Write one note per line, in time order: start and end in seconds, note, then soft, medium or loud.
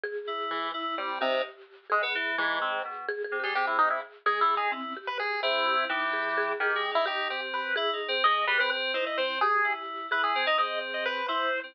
0.04 0.67 G#4 loud
0.27 0.70 E4 medium
0.50 0.71 E3 medium
0.74 0.95 E4 medium
0.74 1.17 E4 medium
0.98 1.19 G3 medium
0.98 1.19 C4 medium
1.21 1.42 C3 loud
1.21 1.42 D#4 medium
1.21 1.84 G4 medium
1.90 2.02 G#3 loud
1.90 2.32 G#4 medium
2.02 2.13 B3 loud
2.15 2.36 E3 loud
2.38 2.80 G#2 loud
2.38 2.59 E3 loud
2.38 3.01 G#4 medium
2.61 2.82 C4 medium
2.85 3.06 B2 medium
3.08 3.23 G#4 loud
3.24 3.38 G#4 medium
3.32 3.42 C3 medium
3.40 3.54 G3 medium
3.40 3.54 G4 medium
3.40 3.54 G#4 medium
3.55 3.98 C3 medium
3.55 3.66 G4 loud
3.55 4.19 G#4 medium
3.67 3.77 E4 medium
3.78 3.89 D#4 loud
3.90 4.01 E4 medium
4.26 4.40 G#3 medium
4.26 4.40 G#4 medium
4.26 4.68 G#4 loud
4.41 4.55 G3 medium
4.41 4.55 E4 medium
4.56 4.70 D#4 medium
4.56 4.71 G#4 medium
4.72 4.93 C4 loud
4.72 4.93 E4 soft
4.96 5.39 G4 medium
5.07 5.18 B4 medium
5.19 5.41 G#4 medium
5.42 5.85 C4 loud
5.42 5.85 E4 medium
5.42 5.64 G#4 medium
5.66 5.77 G4 loud
5.77 5.88 E4 medium
5.89 6.52 E3 loud
5.89 6.12 D#4 loud
5.89 6.53 G4 medium
6.13 6.34 G#4 medium
6.38 6.59 G#4 loud
6.60 6.74 D#3 medium
6.60 6.91 G4 medium
6.60 6.70 G#4 loud
6.70 7.02 G#4 medium
6.75 6.89 G#3 loud
6.91 7.05 D#4 medium
6.91 7.05 E4 loud
7.06 7.27 D#4 medium
7.06 7.69 G4 medium
7.06 7.28 G4 medium
7.30 7.72 C4 medium
7.30 7.41 G4 medium
7.54 7.75 B4 medium
7.76 7.91 E4 loud
7.76 8.18 G#4 loud
7.93 8.07 D#4 medium
8.08 8.22 C4 loud
8.24 8.45 G#3 medium
8.24 8.89 G#4 medium
8.24 8.45 D#5 loud
8.47 8.58 G3 loud
8.47 8.58 B4 loud
8.59 8.70 C4 loud
8.59 8.70 B4 loud
8.71 8.92 C4 loud
8.94 9.05 D#4 medium
8.94 9.36 E4 medium
8.94 9.05 C5 medium
9.06 9.17 E4 medium
9.06 9.17 D#5 medium
9.17 9.39 C4 medium
9.17 9.38 C5 medium
9.41 10.05 G4 loud
9.41 9.73 G#4 loud
9.64 10.06 E4 medium
10.11 10.33 E4 medium
10.11 10.43 G#4 medium
10.11 10.22 B4 medium
10.23 10.45 G#4 medium
10.35 10.46 C4 loud
10.46 10.57 D#4 loud
10.46 10.58 D#5 medium
10.58 11.21 C4 medium
10.58 11.21 G#4 medium
10.58 10.79 D#5 medium
10.94 11.04 D#5 medium
11.05 11.26 B4 loud
11.28 11.50 E4 medium
11.28 11.71 E4 medium
11.28 11.60 C5 medium
11.63 11.74 C4 medium